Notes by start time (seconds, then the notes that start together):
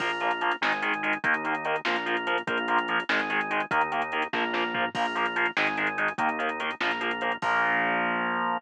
0.00 A#1 F3 A#3 F4, kick, crash
0.10 closed hi-hat
0.20 F3 A#3, closed hi-hat
0.31 closed hi-hat
0.41 F3 A#3, closed hi-hat
0.51 closed hi-hat
0.61 G#1 D#3 G#3 D#4, snare
0.72 closed hi-hat
0.82 D#3 G#3, closed hi-hat
0.94 closed hi-hat
1.03 D#3 G#3, closed hi-hat
1.13 closed hi-hat
1.24 D#2 D#3 A#3 D#4, kick, closed hi-hat
1.34 closed hi-hat
1.44 D#3 A#3, closed hi-hat
1.55 closed hi-hat
1.65 D#3 A#3, closed hi-hat
1.76 closed hi-hat
1.85 A#1 F3 A#3 F4, snare
1.96 closed hi-hat
2.06 F3 A#3, closed hi-hat
2.17 closed hi-hat
2.27 F3 A#3, closed hi-hat
2.38 closed hi-hat
2.47 A#1 F3 A#3 F4, kick, closed hi-hat
2.57 closed hi-hat
2.68 F3 A#3, closed hi-hat
2.78 closed hi-hat
2.88 F3 A#3, closed hi-hat
3.00 closed hi-hat
3.09 G#1 D#3 G#3 D#4, snare
3.19 closed hi-hat
3.30 D#3 G#3, closed hi-hat
3.41 closed hi-hat
3.51 D#3 G#3, closed hi-hat
3.60 closed hi-hat
3.71 D#2 D#3 A#3 D#4, kick, closed hi-hat
3.81 closed hi-hat
3.92 D#3 A#3, closed hi-hat
4.02 closed hi-hat
4.12 D#3 A#3, closed hi-hat
4.22 closed hi-hat
4.33 A#1 F3 A#3 F4, kick, snare
4.53 F3 A#3, snare
4.74 F3 A#3, floor tom
4.95 A#1 F3 A#3 F4, kick, crash
5.05 closed hi-hat
5.15 F3 A#3, closed hi-hat
5.26 closed hi-hat
5.36 F3 A#3, closed hi-hat
5.46 closed hi-hat
5.57 G#1 D#3 G#3 D#4, snare
5.67 closed hi-hat
5.77 D#3 G#3, closed hi-hat
5.87 closed hi-hat
5.98 D#3 G#3, closed hi-hat
6.08 closed hi-hat
6.18 D#2 D#3 A#3 D#4, kick, closed hi-hat
6.29 closed hi-hat
6.39 D#3 A#3, closed hi-hat
6.49 closed hi-hat
6.60 D#3 A#3, closed hi-hat
6.71 closed hi-hat
6.80 A#1 F3 A#3 F4, snare
6.91 closed hi-hat
7.01 F3 A#3, closed hi-hat
7.11 closed hi-hat
7.21 F3 A#3, closed hi-hat
7.32 closed hi-hat
7.42 A#1 F3 A#3 F4, kick, crash